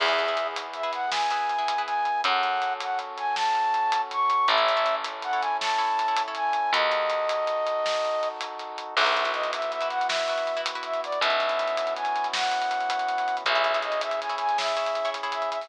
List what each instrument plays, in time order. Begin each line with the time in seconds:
0.00 electric bass (finger) E2, brass section B3 E4 G#4, orchestral harp E4 G#4 B4, flute E5, kick, crash
0.08 orchestral harp E4 G#4 B4
0.19 closed hi-hat
0.28 orchestral harp E4 G#4 B4
0.37 closed hi-hat
0.56 closed hi-hat
0.74 flute E5, closed hi-hat
0.83 orchestral harp E4 G#4 B4
0.93 flute F#5, closed hi-hat
1.12 orchestral harp E4 G#4 B4, flute G#5, snare
1.31 orchestral harp E4 G#4 B4, closed hi-hat
1.49 closed hi-hat
1.58 orchestral harp E4 G#4 B4
1.68 closed hi-hat
1.78 orchestral harp E4 G#4 B4
1.86 flute G#5, closed hi-hat
2.05 closed hi-hat
2.24 electric bass (finger) F#2, brass section C#4 F#4 A4, flute F#5, kick, closed hi-hat
2.43 closed hi-hat
2.62 closed hi-hat
2.80 flute F#5, closed hi-hat
2.99 closed hi-hat
3.18 flute G#5, closed hi-hat
3.36 flute A5, snare
3.55 closed hi-hat
3.74 closed hi-hat
3.92 closed hi-hat
4.11 flute C#6, closed hi-hat
4.30 closed hi-hat
4.48 electric bass (finger) A1, brass section C#4 E4 A4, orchestral harp E4 A4 C#5, flute E5, kick, closed hi-hat
4.58 orchestral harp E4 A4 C#5
4.68 closed hi-hat
4.77 orchestral harp E4 A4 C#5
4.86 closed hi-hat
5.04 closed hi-hat
5.22 flute F#5, closed hi-hat
5.33 orchestral harp E4 A4 C#5
5.41 flute G#5, closed hi-hat
5.61 orchestral harp E4 A4 C#5, flute A5, snare
5.78 orchestral harp E4 A4 C#5, closed hi-hat
5.99 closed hi-hat
6.08 orchestral harp E4 A4 C#5
6.17 closed hi-hat
6.28 orchestral harp E4 A4 C#5
6.35 flute G#5, closed hi-hat
6.53 closed hi-hat
6.73 electric bass (finger) D#2, brass section D#4 F#4 A4, flute D#5, kick, closed hi-hat
6.92 closed hi-hat
7.10 closed hi-hat
7.29 closed hi-hat
7.47 closed hi-hat
7.67 closed hi-hat
7.86 snare
8.05 closed hi-hat
8.23 closed hi-hat
8.41 closed hi-hat
8.59 closed hi-hat
8.78 closed hi-hat
8.95 electric bass (finger) B1, brass section B3 E4 F#4, orchestral harp E4 F#4 B4, flute E5, kick, crash
9.05 orchestral harp E4 F#4 B4, closed hi-hat
9.17 closed hi-hat
9.25 orchestral harp E4 F#4 B4, closed hi-hat
9.33 flute D#5, closed hi-hat
9.44 closed hi-hat
9.53 flute E5, closed hi-hat
9.62 closed hi-hat
9.72 flute E5, closed hi-hat
9.81 orchestral harp E4 F#4 B4, closed hi-hat
9.90 flute F#5, closed hi-hat
10.01 closed hi-hat
10.09 orchestral harp E4 F#4 B4, flute E5, snare
10.18 closed hi-hat
10.28 orchestral harp E4 F#4 B4, closed hi-hat
10.38 closed hi-hat
10.47 closed hi-hat
10.57 orchestral harp E4 F#4 B4, closed hi-hat
10.66 closed hi-hat
10.75 orchestral harp E4 F#4 B4, closed hi-hat
10.83 flute E5, closed hi-hat
10.94 closed hi-hat
11.04 flute D5, closed hi-hat
11.12 closed hi-hat
11.21 electric bass (finger) B1, brass section B3 C#4 E4 F#4, flute E5, kick, closed hi-hat
11.30 closed hi-hat
11.40 closed hi-hat
11.49 closed hi-hat
11.59 closed hi-hat
11.68 closed hi-hat
11.77 closed hi-hat
11.87 closed hi-hat
11.96 flute G#5, closed hi-hat
12.05 closed hi-hat
12.16 closed hi-hat
12.24 closed hi-hat
12.33 flute F#5, snare
12.43 closed hi-hat
12.52 closed hi-hat
12.62 closed hi-hat
12.71 closed hi-hat
12.81 closed hi-hat
12.90 closed hi-hat
12.99 closed hi-hat
13.09 closed hi-hat
13.18 closed hi-hat
13.28 closed hi-hat
13.37 closed hi-hat
13.45 electric bass (finger) B1, brass section C#4 E4 G#4, orchestral harp E4 G#4 C#5, flute E5, kick, closed hi-hat
13.55 orchestral harp E4 G#4 C#5, closed hi-hat
13.64 closed hi-hat
13.74 orchestral harp E4 G#4 C#5, closed hi-hat
13.82 flute D#5, closed hi-hat
13.92 closed hi-hat
14.01 flute E5, closed hi-hat
14.11 closed hi-hat
14.20 flute G#5, closed hi-hat
14.30 orchestral harp E4 G#4 C#5, closed hi-hat
14.38 flute G#5, closed hi-hat
14.49 closed hi-hat
14.58 orchestral harp E4 G#4 C#5, flute E5, snare
14.67 closed hi-hat
14.77 orchestral harp E4 G#4 C#5, closed hi-hat
14.86 closed hi-hat
14.95 closed hi-hat
15.05 orchestral harp E4 G#4 C#5, closed hi-hat
15.14 closed hi-hat
15.23 orchestral harp E4 G#4 C#5, closed hi-hat
15.32 flute E5, closed hi-hat
15.42 closed hi-hat
15.51 flute E5, closed hi-hat
15.61 open hi-hat